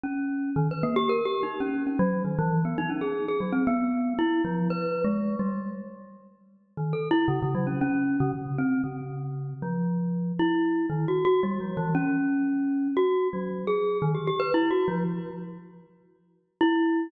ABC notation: X:1
M:4/4
L:1/16
Q:1/4=116
K:none
V:1 name="Glockenspiel"
_D4 | _E, B _B, G (3_B2 G2 _E2 _D2 D _G,2 E, =E,2 | B, _E _D _A2 A _G, C B,4 =E2 F,2 | (3B4 _A,4 G,4 z8 |
(3_E,2 A2 =E2 _D, D, _G, _D D3 D, z2 C2 | _D,6 F,6 E4 | (3_E,2 _G2 G2 (3=G,2 F,2 =E,2 _D8 | (3_G4 _G,4 _A4 _E, =G G B (3=E2 _G2 F,2 |
z12 E4 |]